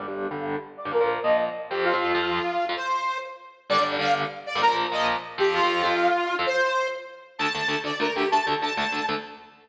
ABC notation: X:1
M:6/8
L:1/16
Q:3/8=130
K:Gphr
V:1 name="Lead 2 (sawtooth)"
d2 z2 f2 z4 d2 | B2 z2 e2 z4 G2 | F12 | c6 z6 |
d2 z2 f2 z4 d2 | B2 z2 e2 z4 G2 | F12 | c6 z6 |
[K:Dphr] a6 d2 B2 G2 | a2 z2 a2 a4 z2 |]
V:2 name="Overdriven Guitar"
[G,,D,G,] [G,,D,G,]3 [G,,D,G,]7 [G,,D,G,] | [B,,F,B,] [B,,F,B,]3 [B,,F,B,]6 [F,,F,C]2- | [F,,F,C] [F,,F,C]3 [F,,F,C]7 [F,,F,C] | z12 |
[G,,D,G,] [G,,D,G,]3 [G,,D,G,]7 [G,,D,G,] | [B,,F,B,] [B,,F,B,]3 [B,,F,B,]6 [F,,F,C]2- | [F,,F,C] [F,,F,C]3 [F,,F,C]7 [F,,F,C] | z12 |
[K:Dphr] [D,,D,A,]2 [D,,D,A,]2 [D,,D,A,]2 [D,,D,A,]2 [D,,D,A,]2 [D,,D,A,]2 | [D,,D,A,]2 [D,,D,A,]2 [D,,D,A,]2 [D,,D,A,]2 [D,,D,A,]2 [D,,D,A,]2 |]